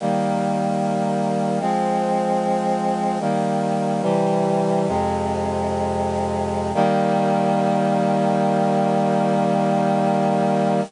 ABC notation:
X:1
M:4/4
L:1/8
Q:1/4=75
K:Eb
V:1 name="Brass Section"
[E,G,B,]4 [F,A,C]4 | "^rit." [E,G,B,]2 [C,=E,G,]2 [F,,C,A,]4 | [E,G,B,]8 |]